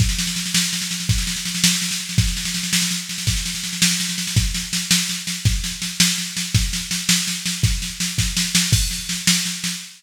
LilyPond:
\new DrumStaff \drummode { \time 6/8 \tempo 4. = 110 <bd sn>16 sn16 sn16 sn16 sn16 sn16 sn16 sn16 sn16 sn16 sn16 sn16 | <bd sn>16 sn16 sn16 sn16 sn16 sn16 sn16 sn16 sn16 sn16 sn16 sn16 | <bd sn>16 sn16 sn16 sn16 sn16 sn16 sn16 sn16 sn8 sn16 sn16 | <bd sn>16 sn16 sn16 sn16 sn16 sn16 sn16 sn16 sn16 sn16 sn16 sn16 |
<bd sn>8 sn8 sn8 sn8 sn8 sn8 | <bd sn>8 sn8 sn8 sn8 sn8 sn8 | <bd sn>8 sn8 sn8 sn8 sn8 sn8 | <bd sn>8 sn8 sn8 <bd sn>8 sn8 sn8 |
<cymc bd sn>8 sn8 sn8 sn8 sn8 sn8 | }